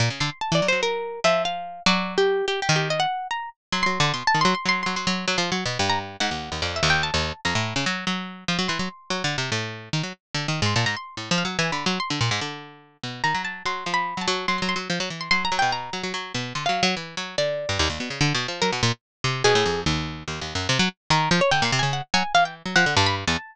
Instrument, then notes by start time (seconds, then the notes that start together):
pizzicato strings
0.00 A#2
0.10 C#3
0.20 D3 C6
0.41 A5
0.52 E3 D5
0.62 F#3
0.68 C5
0.72 F#3
0.83 A#4
1.24 F3 E5
1.45 F5
1.86 F#3 D5
2.18 G4
2.48 G4
2.62 G4
2.69 D#3
2.76 G4
2.90 D#5
3.00 F#5
3.31 A#5
3.72 F#3 C6
3.83 F#3 C6
4.00 D3
4.14 B2 C6
4.27 A5
4.34 D#3
4.41 F#3 C6
4.55 C6
4.66 F#3 C6
4.83 F#3 C6
4.96 F#3 C6
5.07 F#3
5.28 F#3
5.38 F3 C6
5.52 F#3
5.66 B2
5.79 G2
5.89 A#5
6.20 G#2 F#5
6.31 D#2
6.52 D#2
6.62 F2 D5
6.76 E5
6.83 D#2
6.90 G5
7.03 A5
7.14 D#2
7.45 F2 A#5
7.55 A2
7.76 C#3
7.86 F#3
8.07 F#3
8.48 F3
8.59 F#3
8.68 E3 C6
8.79 F#3
9.10 F#3
9.24 D3
9.38 C3
9.52 A2
9.93 D#3
10.03 F#3
10.34 D3
10.48 D#3
10.62 G#2 C6
10.76 A#2 A5
10.86 G#2 A#5
10.97 C6
11.17 A2
11.31 F3
11.38 F5
11.45 F#3
11.59 E3 G#5
11.72 D3 B5
11.86 F#3 C6
12.00 C6
12.10 D3
12.21 A#2
12.31 G#2
12.41 D3
13.03 B2
13.24 D#3 A#5
13.34 F#3
13.45 A5
13.66 F#3 C6
13.86 F3
13.94 B5
14.17 F#3
14.21 A5
14.28 F#3
14.48 F#3 C6
14.58 F#3 C6
14.69 C6
14.76 F#3
14.90 F3
15.00 F#3
15.10 E3
15.21 C6
15.31 F#3 C6
15.45 A#5
15.52 F#3
15.59 B2 G5
15.72 A#5
15.93 F#3
16.03 F#3
16.14 F#3
16.34 B2
16.55 D3 C6
16.66 F#3 F5
16.83 F#3
16.97 E3
17.17 F#3
17.38 D3 D5
17.69 G2
17.79 D#2
17.90 D#2
18.00 B2
18.10 C#3
18.21 D3
18.34 B2
18.48 F3
18.62 F#3 A#4
18.72 B2
18.83 A#2
19.24 C3
19.44 B2 G#4
19.55 A2
19.66 F2
19.86 D#2
20.28 D#2
20.41 D#2
20.55 F#2
20.69 C3
20.79 F#3
21.10 D#3 A#4
21.31 F3
21.41 C#5
21.51 D3 G5
21.62 A#2 C6
21.72 C3
21.79 C#3 G#5
21.93 F#5
22.14 F#3 G#5
22.34 E3 F5
22.45 G5
22.66 F#3
22.76 F3 F#5
22.86 D3
22.97 G2 A5
23.06 B5
23.27 E2 A5